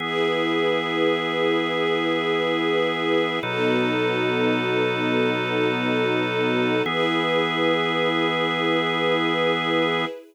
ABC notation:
X:1
M:4/4
L:1/8
Q:1/4=70
K:E
V:1 name="Drawbar Organ"
[E,B,G]8 | [B,,F,DA]8 | [E,B,G]8 |]
V:2 name="String Ensemble 1"
[EGB]8 | [B,DFA]8 | [EGB]8 |]